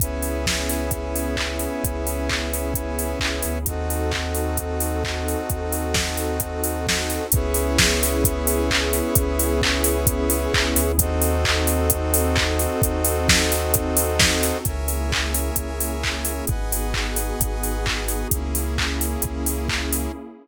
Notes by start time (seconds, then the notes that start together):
0.00 C#2 B3 C#4 E4 G#4 B4 C#5 E5, kick, closed hi-hat
0.22 open hi-hat
0.46 kick, snare
0.69 open hi-hat
0.91 kick, closed hi-hat
1.16 open hi-hat
1.37 kick, clap
1.59 open hi-hat
1.84 C#2, kick, closed hi-hat
2.07 open hi-hat
2.29 kick, clap
2.54 open hi-hat
2.74 kick, closed hi-hat
2.99 open hi-hat
3.20 C#2, kick, clap
3.42 D2, open hi-hat
3.65 D#2 C4 D#4 F#4 A4 C5 D#5 F#5, kick, closed hi-hat
3.90 open hi-hat
4.11 kick, clap
4.35 open hi-hat
4.57 kick, closed hi-hat
4.80 open hi-hat
5.04 kick, clap
5.28 open hi-hat
5.50 D#2, kick, closed hi-hat
5.72 open hi-hat
5.94 kick, snare
6.17 open hi-hat
6.40 kick, closed hi-hat
6.64 open hi-hat
6.87 kick, snare
7.10 open hi-hat
7.32 C#2 B3 C#4 E4 G#4 B4 C#5 E5, kick, closed hi-hat
7.54 open hi-hat
7.78 kick, snare
8.03 open hi-hat
8.24 kick, closed hi-hat
8.47 open hi-hat
8.71 kick, clap
8.93 open hi-hat
9.15 C#2, kick, closed hi-hat
9.39 open hi-hat
9.62 kick, clap
9.84 open hi-hat
10.07 kick, closed hi-hat
10.30 open hi-hat
10.53 C#2, kick, clap
10.76 D2, open hi-hat
10.98 D#2 C4 D#4 F#4 A4 C5 D#5 F#5, kick, closed hi-hat
11.22 open hi-hat
11.45 kick, clap
11.67 open hi-hat
11.90 kick, closed hi-hat
12.14 open hi-hat
12.36 kick, clap
12.59 open hi-hat
12.82 D#2, kick, closed hi-hat
13.04 open hi-hat
13.29 kick, snare
13.52 open hi-hat
13.74 kick, closed hi-hat
13.97 open hi-hat
14.19 kick, snare
14.43 open hi-hat
14.65 C#2 A#3 C#4 E4 G#4 A#4 C#5 E5 G#5, kick, closed hi-hat
14.88 open hi-hat
15.12 kick, clap
15.34 open hi-hat
15.56 C#2, kick, closed hi-hat
15.80 open hi-hat
16.04 kick, clap
16.25 open hi-hat
16.47 G#1 B3 D#4 F#4 G#4 B4 D#5 F#5 G#5, kick, closed hi-hat
16.72 open hi-hat
16.94 kick, clap
17.16 open hi-hat
17.40 G#1, kick, closed hi-hat
17.63 open hi-hat
17.86 kick, clap
18.08 open hi-hat
18.31 C#2 A#3 C#4 E4 G#4, kick, closed hi-hat
18.55 open hi-hat
18.78 kick, clap
19.01 open hi-hat
19.22 C#2, kick, closed hi-hat
19.46 open hi-hat
19.69 kick, clap
19.93 open hi-hat